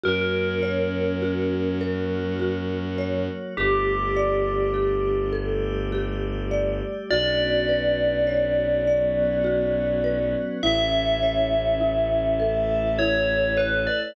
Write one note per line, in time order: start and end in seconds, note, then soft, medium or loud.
0.03 3.29 F#2 medium
0.03 1.78 A#3 loud
0.03 1.78 C#4 medium
0.03 0.62 F#4 medium
0.03 1.78 F#4 loud
0.03 3.26 A#4 medium
0.63 1.22 C#5 medium
1.22 1.81 F#4 medium
1.79 3.54 F#3 medium
1.79 3.54 A#3 medium
1.79 3.54 F#4 medium
1.79 2.40 A#4 medium
2.39 2.98 F#4 medium
2.98 3.54 C#5 medium
3.57 6.82 G1 medium
3.57 5.32 A3 medium
3.57 5.32 D4 medium
3.57 5.20 G4 medium
3.57 5.32 G4 medium
3.57 4.17 G4 medium
4.16 4.75 D5 medium
4.74 5.33 G4 medium
5.33 7.09 G3 medium
5.33 7.09 A3 medium
5.33 7.09 G4 medium
5.33 5.91 A4 medium
5.92 6.51 G4 medium
6.51 7.07 D5 medium
7.10 10.35 B1 medium
7.10 8.84 B3 loud
7.10 8.84 C#4 medium
7.10 8.84 D4 medium
7.10 8.84 F#4 medium
7.10 9.44 F#4 medium
7.10 10.32 D5 medium
7.69 10.03 B4 medium
8.27 10.50 C#5 medium
8.86 10.60 F#3 medium
8.86 10.60 B3 loud
8.86 10.60 C#4 medium
8.86 10.60 F#4 medium
8.86 10.55 D5 medium
9.44 10.56 F#4 medium
10.04 10.60 B4 medium
10.63 13.88 A1 medium
10.63 12.37 A3 medium
10.63 12.37 C#4 loud
10.63 12.37 E4 medium
10.63 11.80 E4 medium
10.63 12.90 E5 medium
11.23 13.56 C#5 soft
11.80 12.99 E4 medium
12.39 14.14 A3 loud
12.39 14.14 E4 loud
12.39 14.14 A4 medium
12.39 14.07 A4 medium
12.99 14.11 E4 medium
12.99 13.53 C#5 medium
13.57 13.85 B4 medium
13.57 14.13 C#5 medium
13.87 14.15 D5 medium